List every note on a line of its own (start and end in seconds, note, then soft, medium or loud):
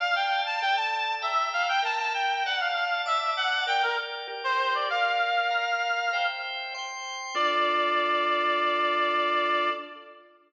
0.00 0.61 D5 medium
0.00 0.15 F5 loud
0.00 0.61 F5 medium
0.00 0.61 A5 medium
0.15 0.43 G5 medium
0.46 0.61 A5 medium
0.61 1.23 A4 medium
0.61 1.23 D5 medium
0.61 0.76 G5 medium
0.61 1.23 A5 medium
0.76 1.15 A5 medium
1.22 1.82 E5 medium
1.22 1.49 E5 medium
1.22 1.83 G5 medium
1.22 1.82 A#5 loud
1.53 1.67 F5 medium
1.68 1.83 G5 medium
1.82 2.43 A#4 medium
1.82 2.43 E5 loud
1.82 1.98 A5 medium
1.82 2.43 A#5 medium
1.99 2.13 A5 medium
2.14 2.43 G5 medium
2.46 3.05 D5 medium
2.46 2.60 F#5 medium
2.46 3.06 F#5 medium
2.46 3.05 A5 medium
2.60 2.75 F5 medium
2.75 3.01 F5 medium
3.05 3.66 D5 medium
3.05 3.32 E5 medium
3.05 3.66 A5 medium
3.05 3.66 D6 medium
3.37 3.64 F#5 medium
3.67 4.27 A#4 medium
3.67 4.27 D5 medium
3.67 4.27 G5 medium
3.67 3.82 G5 medium
3.83 3.97 A#4 medium
4.28 4.88 G4 medium
4.28 4.88 A#4 loud
4.28 4.88 G5 medium
4.44 4.73 C5 medium
4.75 4.89 D5 medium
4.90 5.50 A#4 loud
4.90 5.51 D5 loud
4.90 6.26 F5 medium
4.90 5.50 F5 medium
5.51 6.11 A#4 medium
5.51 6.11 F5 medium
5.51 6.11 A#5 medium
6.13 6.73 C5 loud
6.13 6.73 E5 medium
6.13 6.73 G5 loud
6.74 7.35 C5 medium
6.74 7.35 G5 medium
6.74 7.35 C6 loud
7.35 9.70 D4 loud
7.35 9.70 F4 loud
7.35 9.70 A4 loud
7.35 9.70 D5 loud